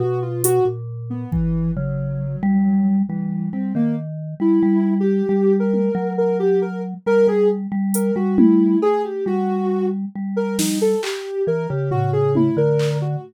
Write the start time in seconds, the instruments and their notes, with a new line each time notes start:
0.00 vibraphone B2, ocarina F#4
0.22 ocarina F4
0.44 ocarina F#4, closed hi-hat
0.65 vibraphone A#2
1.10 ocarina B3
1.32 ocarina E3, kick
1.76 vibraphone C#3, ocarina F#3
2.43 vibraphone G3
3.09 ocarina E3, vibraphone G3
3.53 vibraphone G3, ocarina C4
3.75 vibraphone D#3, ocarina A#3
4.40 vibraphone G3, ocarina E4
4.63 vibraphone G3
5.00 ocarina G4
5.29 vibraphone G3
5.60 ocarina A#4
5.74 high tom
5.95 vibraphone F#3
6.18 ocarina A#4
6.40 ocarina G4
6.62 ocarina A#4
7.06 vibraphone G3, ocarina A#4
7.27 vibraphone G3, ocarina G#4
7.72 vibraphone G3
7.94 ocarina A#4, closed hi-hat
8.16 vibraphone G3, ocarina F#4
8.38 ocarina E4, high tom
8.82 ocarina G#4, cowbell
9.04 ocarina G4
9.26 vibraphone G3, ocarina F#4
10.15 vibraphone G3
10.36 ocarina A#4
10.59 ocarina D#4, snare
10.81 ocarina A4
11.03 ocarina G4, clap
11.47 vibraphone E3, ocarina A#4
11.69 vibraphone C#3, ocarina G4
11.91 ocarina F#4, floor tom
12.13 ocarina G#4
12.35 ocarina E4, high tom
12.57 vibraphone D3, ocarina A#4
12.79 clap
13.01 ocarina F#4